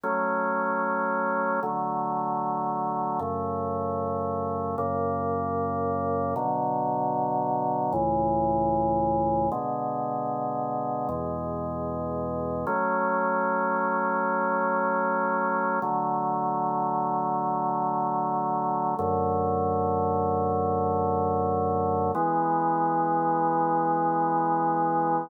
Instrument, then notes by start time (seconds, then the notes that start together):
drawbar organ
0.03 F#3 A3 C#4
1.63 D3 F#3 A3
3.19 F#2 C#3 A3
4.78 F#2 C#3 A#3
6.36 B2 D3 F#3
7.93 C#2 A2 E3
9.52 B2 D3 G#3
11.09 E2 B2 G#3
12.67 F#3 A3 C#4
15.82 D3 F#3 A3
18.99 F#2 D3 A3
22.15 E3 G#3 B3